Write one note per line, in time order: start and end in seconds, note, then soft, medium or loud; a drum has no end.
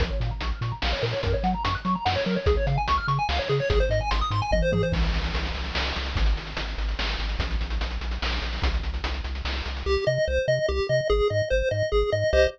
0.00 0.10 A#1 medium
0.00 0.09 A#4 medium
0.00 kick medium
0.00 closed hi-hat medium
0.10 0.20 C#5 medium
0.20 0.32 A#2 medium
0.20 0.30 F5 medium
0.20 closed hi-hat medium
0.31 0.40 A#5 medium
0.41 0.53 A#1 medium
0.41 0.50 C#6 medium
0.41 closed hi-hat medium
0.51 0.61 F6 medium
0.61 0.73 A#2 medium
0.61 0.71 C#6 medium
0.61 closed hi-hat medium
0.72 0.81 A#5 medium
0.82 0.94 A#1 medium
0.82 0.91 F5 medium
0.82 snare loud
0.93 1.02 C#5 medium
1.02 1.14 A#2 medium
1.02 1.12 A#4 medium
1.02 open hi-hat medium
1.13 1.22 C#5 medium
1.23 1.35 F#2 medium
1.23 1.33 A#4 medium
1.23 kick medium
1.23 closed hi-hat medium
1.34 1.43 C#5 medium
1.43 1.55 F#3 medium
1.43 1.53 F#5 medium
1.43 closed hi-hat medium
1.54 1.64 A#5 medium
1.64 1.77 F#2 medium
1.64 1.74 C#6 medium
1.64 closed hi-hat loud
1.75 1.84 F#6 medium
1.85 1.96 F#3 medium
1.85 1.94 C#6 medium
1.85 closed hi-hat medium
1.95 2.05 A#5 medium
2.05 2.17 F#2 medium
2.05 2.15 F#5 medium
2.05 snare medium
2.16 2.25 C#5 medium
2.26 2.37 F#3 medium
2.26 2.35 A#4 medium
2.26 closed hi-hat medium
2.36 2.46 C#5 medium
2.46 2.58 C#2 medium
2.46 2.56 G#4 medium
2.46 kick medium
2.46 closed hi-hat medium
2.57 2.66 C#5 medium
2.67 2.78 C#3 medium
2.67 2.76 F5 medium
2.67 closed hi-hat medium
2.78 2.87 G#5 medium
2.88 3.00 C#2 medium
2.88 2.97 C#6 medium
2.88 closed hi-hat medium
2.98 3.07 F6 medium
3.08 3.19 C#3 medium
3.08 3.17 C#6 medium
3.08 closed hi-hat medium
3.19 3.28 G#5 medium
3.29 3.40 C#2 medium
3.29 3.38 F5 medium
3.29 snare medium
3.39 3.48 C#5 medium
3.49 3.61 C#3 medium
3.49 3.59 G#4 medium
3.49 closed hi-hat soft
3.60 3.69 C#5 medium
3.70 3.82 G#1 medium
3.70 3.79 G#4 medium
3.70 kick medium
3.70 closed hi-hat medium
3.80 3.89 C5 medium
3.89 4.01 G#2 medium
3.89 4.00 D#5 medium
3.89 closed hi-hat medium
4.01 4.10 G#5 medium
4.11 4.23 G#1 medium
4.11 4.20 C6 medium
4.11 closed hi-hat loud
4.21 4.30 D#6 medium
4.31 4.42 G#2 medium
4.31 4.41 C6 medium
4.31 closed hi-hat medium
4.42 4.51 G#5 medium
4.51 4.62 G#1 medium
4.51 4.62 D#5 medium
4.51 kick medium
4.51 high tom medium
4.62 4.72 C5 medium
4.72 4.84 G#2 medium
4.72 4.82 G#4 medium
4.72 high tom medium
4.83 4.92 C5 medium
4.92 5.11 C2 medium
4.92 kick loud
4.92 crash medium
5.04 closed hi-hat medium
5.13 5.31 C2 medium
5.13 closed hi-hat medium
5.24 closed hi-hat medium
5.34 5.52 C2 medium
5.34 closed hi-hat medium
5.45 closed hi-hat medium
5.54 5.72 C2 medium
5.54 closed hi-hat medium
5.65 closed hi-hat medium
5.75 5.93 C2 medium
5.75 snare loud
5.86 closed hi-hat medium
5.96 6.14 C2 medium
5.96 closed hi-hat medium
6.06 closed hi-hat medium
6.15 6.34 G#1 medium
6.15 kick medium
6.15 closed hi-hat medium
6.26 closed hi-hat medium
6.36 6.54 G#1 medium
6.36 closed hi-hat medium
6.47 closed hi-hat medium
6.57 6.75 G#1 medium
6.57 closed hi-hat medium
6.68 closed hi-hat medium
6.78 6.95 G#1 medium
6.78 closed hi-hat medium
6.89 closed hi-hat medium
6.99 7.16 G#1 medium
6.99 snare medium
7.09 closed hi-hat medium
7.19 7.36 G#1 medium
7.19 closed hi-hat medium
7.29 closed hi-hat medium
7.39 7.56 A#1 medium
7.39 kick medium
7.39 closed hi-hat medium
7.51 closed hi-hat medium
7.61 7.79 A#1 medium
7.61 closed hi-hat medium
7.70 closed hi-hat medium
7.81 7.98 A#1 medium
7.81 closed hi-hat medium
7.91 closed hi-hat medium
8.01 8.19 A#1 medium
8.01 closed hi-hat medium
8.11 closed hi-hat medium
8.22 8.40 A#1 medium
8.22 snare medium
8.32 closed hi-hat medium
8.42 8.59 A#1 medium
8.42 closed hi-hat medium
8.53 open hi-hat medium
8.62 8.80 C2 medium
8.62 kick medium
8.62 closed hi-hat medium
8.74 closed hi-hat medium
8.83 9.01 C2 medium
8.83 closed hi-hat medium
8.94 closed hi-hat medium
9.04 9.21 C2 medium
9.04 closed hi-hat medium
9.14 closed hi-hat medium
9.24 9.42 C2 medium
9.24 closed hi-hat medium
9.35 closed hi-hat medium
9.45 9.62 C2 medium
9.45 snare medium
9.56 closed hi-hat soft
9.65 9.83 C2 medium
9.65 closed hi-hat medium
9.76 closed hi-hat medium
9.86 9.97 C2 medium
9.86 10.05 G4 loud
10.07 10.18 C3 medium
10.07 10.25 D#5 medium
10.28 10.39 C2 medium
10.28 10.46 C5 medium
10.48 10.59 C3 medium
10.48 10.66 D#5 medium
10.68 10.80 C2 medium
10.68 10.87 G4 medium
10.89 11.01 C3 medium
10.89 11.08 D#5 medium
11.10 11.21 G#1 medium
11.10 11.28 G#4 medium
11.30 11.42 G#2 medium
11.30 11.49 D#5 medium
11.50 11.63 G#1 medium
11.50 11.69 C5 medium
11.71 11.83 G#2 medium
11.71 11.90 D#5 medium
11.92 12.04 G#1 medium
11.92 12.10 G#4 medium
12.12 12.24 G#2 medium
12.12 12.31 D#5 medium
12.33 12.47 C2 loud
12.33 12.47 G4 medium
12.33 12.47 C5 medium
12.33 12.47 D#5 loud